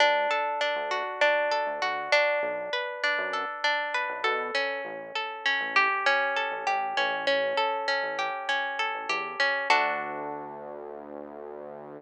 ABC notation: X:1
M:4/4
L:1/16
Q:1/4=99
K:D
V:1 name="Acoustic Guitar (steel)"
D2 A2 D2 F2 D2 A2 F2 D2- | D2 B2 D2 A2 D2 B2 A2 C2- | C2 A2 C2 G2 C2 A2 G2 C2 | C2 A2 C2 G2 C2 A2 G2 C2 |
[DFA]16 |]
V:2 name="Synth Bass 1" clef=bass
D,,5 D,,6 D,, D,,4 | B,,,5 F,,6 B,,, B,,4 | A,,,5 A,,,6 A,,, A,,,2 A,,,2- | A,,,5 A,,,6 A,,, E,,4 |
D,,16 |]